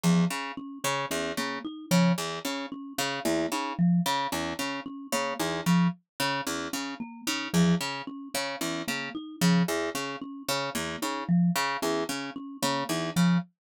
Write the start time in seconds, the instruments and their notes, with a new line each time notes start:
0.03 orchestral harp E2, marimba F3
0.30 orchestral harp C#3
0.57 marimba C#4
0.84 orchestral harp C#3, marimba C#4
1.11 orchestral harp E2, marimba C#4
1.37 orchestral harp C#3, marimba A#3
1.65 marimba D#4
1.91 orchestral harp C#3, marimba F3
2.18 orchestral harp E2
2.45 orchestral harp C#3, marimba C#4
2.72 marimba C#4
2.98 orchestral harp C#3, marimba C#4
3.25 orchestral harp E2, marimba A#3
3.52 orchestral harp C#3, marimba D#4
3.79 marimba F3
4.06 orchestral harp C#3
4.32 orchestral harp E2, marimba C#4
4.59 orchestral harp C#3, marimba C#4
4.86 marimba C#4
5.12 orchestral harp C#3, marimba A#3
5.39 orchestral harp E2, marimba D#4
5.66 orchestral harp C#3, marimba F3
6.20 orchestral harp C#3, marimba C#4
6.47 orchestral harp E2, marimba C#4
6.73 orchestral harp C#3, marimba C#4
7.00 marimba A#3
7.27 orchestral harp C#3, marimba D#4
7.53 orchestral harp E2, marimba F3
7.81 orchestral harp C#3
8.07 marimba C#4
8.34 orchestral harp C#3, marimba C#4
8.61 orchestral harp E2, marimba C#4
8.87 orchestral harp C#3, marimba A#3
9.15 marimba D#4
9.41 orchestral harp C#3, marimba F3
9.68 orchestral harp E2
9.95 orchestral harp C#3, marimba C#4
10.21 marimba C#4
10.48 orchestral harp C#3, marimba C#4
10.75 orchestral harp E2, marimba A#3
11.02 orchestral harp C#3, marimba D#4
11.29 marimba F3
11.55 orchestral harp C#3
11.82 orchestral harp E2, marimba C#4
12.09 orchestral harp C#3, marimba C#4
12.36 marimba C#4
12.62 orchestral harp C#3, marimba A#3
12.89 orchestral harp E2, marimba D#4
13.16 orchestral harp C#3, marimba F3